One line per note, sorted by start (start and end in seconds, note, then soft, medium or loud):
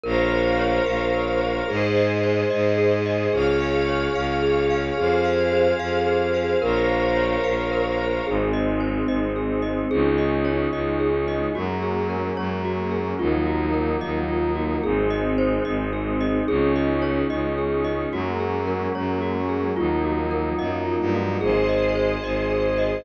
0.03 0.79 A#1 loud
0.03 0.28 A#4 medium
0.03 1.67 A#4 medium
0.03 1.67 C5 medium
0.03 1.67 C#5 medium
0.03 1.67 F5 medium
0.31 0.56 C5 medium
0.59 0.84 C#5 medium
0.86 1.61 A#1 medium
0.86 1.11 F5 medium
1.14 1.38 A#4 medium
1.41 1.66 C5 medium
1.68 2.44 G#2 loud
1.68 1.93 G#4 medium
1.68 3.31 G#4 medium
1.68 3.31 C5 medium
1.68 3.31 D#5 medium
1.96 2.21 D#5 medium
2.23 2.48 C5 medium
2.50 3.27 G#2 loud
2.50 2.75 D#5 medium
2.78 3.02 G#4 medium
3.06 3.30 D#5 medium
3.33 4.08 C#2 loud
3.33 4.96 G#4 medium
3.33 3.58 G#4 medium
3.33 4.96 C#5 medium
3.33 4.96 F5 medium
3.60 3.85 F5 medium
3.88 4.13 C#5 medium
4.15 4.91 C#2 medium
4.15 4.40 F5 medium
4.42 4.67 G#4 medium
4.70 4.95 F5 medium
4.97 5.73 F2 medium
4.97 6.60 G#4 medium
4.97 5.22 G#4 medium
4.97 6.60 C5 medium
4.97 6.60 F5 medium
5.25 5.50 F5 medium
5.52 5.77 C5 medium
5.79 6.55 F2 medium
5.79 6.04 F5 medium
6.07 6.31 G#4 medium
6.34 6.59 F5 medium
6.62 7.37 A#1 loud
6.62 8.24 A#4 medium
6.62 6.86 A#4 medium
6.62 8.24 C5 medium
6.62 8.24 C#5 medium
6.62 8.24 F5 medium
6.89 7.14 C5 medium
7.16 7.41 C#5 medium
7.44 8.20 A#1 medium
7.44 7.69 F5 medium
7.72 7.96 A#4 medium
7.98 8.23 C5 medium
8.26 9.02 G#1 medium
8.26 9.89 G#3 medium
8.26 9.89 C4 medium
8.26 9.89 D#4 medium
8.26 8.51 G#4 medium
8.53 8.78 D#5 medium
8.80 9.05 C5 medium
9.08 9.84 G#1 medium
9.08 9.33 D#5 medium
9.36 9.61 G#4 medium
9.62 9.87 D#5 medium
9.91 10.67 C#2 loud
9.91 11.53 G#3 medium
9.91 11.53 C#4 medium
9.91 11.53 D#4 medium
9.91 10.16 G#4 medium
10.18 10.43 D#5 medium
10.45 10.69 C#5 medium
10.72 11.48 C#2 medium
10.72 10.97 D#5 medium
11.00 11.24 G#4 medium
11.28 11.53 D#5 medium
11.55 12.30 F#2 medium
11.55 13.18 F#3 medium
11.55 13.18 G#3 medium
11.55 13.18 A#3 medium
11.55 13.18 C#4 medium
11.55 11.80 F#4 medium
11.83 12.07 G#4 medium
12.10 12.34 A#4 medium
12.37 13.13 F#2 medium
12.37 12.62 C#5 medium
12.65 12.89 F#4 medium
12.91 13.16 G#4 medium
13.19 13.95 D#2 medium
13.19 14.82 F3 medium
13.19 14.82 F#3 medium
13.19 14.82 A#3 medium
13.19 14.82 D#4 medium
13.19 13.44 F4 medium
13.46 13.71 F#4 medium
13.74 13.98 A#4 medium
14.01 14.77 D#2 medium
14.01 14.26 D#5 medium
14.28 14.53 F4 medium
14.55 14.80 F#4 medium
14.83 15.59 G#1 medium
14.83 16.46 G#3 medium
14.83 16.46 C4 medium
14.83 16.46 D#4 medium
14.83 15.08 G#4 medium
15.10 15.35 D#5 medium
15.38 15.63 C5 medium
15.65 16.41 G#1 medium
15.65 15.90 D#5 medium
15.93 16.18 G#4 medium
16.21 16.45 D#5 medium
16.48 17.23 C#2 loud
16.48 18.11 G#3 medium
16.48 18.11 C#4 medium
16.48 18.11 D#4 medium
16.48 16.73 G#4 medium
16.76 17.00 D#5 medium
17.02 17.27 C#5 medium
17.30 18.06 C#2 medium
17.30 17.55 D#5 medium
17.58 17.83 G#4 medium
17.84 18.09 D#5 medium
18.12 18.87 F#2 medium
18.12 19.75 F#3 medium
18.12 19.75 G#3 medium
18.12 19.75 A#3 medium
18.12 19.75 C#4 medium
18.12 18.38 F#4 medium
18.40 18.64 G#4 medium
18.67 18.92 A#4 medium
18.95 19.71 F#2 medium
18.95 19.20 C#5 medium
19.22 19.46 F#4 medium
19.49 19.74 G#4 medium
19.76 20.53 D#2 medium
19.76 21.40 F3 medium
19.76 21.40 F#3 medium
19.76 21.40 A#3 medium
19.76 21.40 D#4 medium
19.76 20.01 F4 medium
20.04 20.29 F#4 medium
20.31 20.56 A#4 medium
20.59 20.96 F#2 medium
20.59 20.83 D#5 medium
20.86 21.10 F4 medium
21.00 21.37 G2 medium
21.14 21.39 F#4 medium
21.41 22.16 G#1 medium
21.41 21.66 G#4 medium
21.41 23.04 G#4 medium
21.41 23.04 C5 medium
21.41 23.04 D#5 medium
21.69 21.93 D#5 medium
21.95 22.20 C5 medium
22.23 22.99 G#1 medium
22.23 22.48 D#5 medium
22.51 22.76 G#4 medium
22.78 23.03 D#5 medium